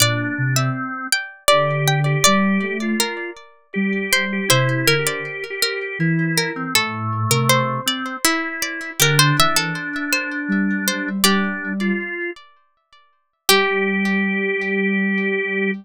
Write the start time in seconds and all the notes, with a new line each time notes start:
0.00 A#2 D4 D5
0.38 C3
0.56 C4 E5
1.12 G5
1.48 D3 G4 D5
1.88 G5
2.06 G4
2.24 G3 G4 D5
2.62 A3
2.82 F4
3.00 A#4
3.74 G3 G4
4.13 C5
4.33 G4
4.49 C3 E4 C5 E5
4.87 D3 A#4
4.99 G4
5.07 D5
5.50 G4
5.62 A#4
5.99 E3 E4
6.38 A#4
6.56 C4
6.75 A2 A3 A4
7.30 C3 A#4
7.49 C5
7.86 C4 D5
8.25 E4
8.62 D5
9.00 D3 D4 G4 A#4
9.19 C5
9.38 E3 E5
9.56 A4
10.12 C5
10.48 G3
10.88 C5
11.24 G3 D4 G4 D5
11.81 F4
13.49 G3 G4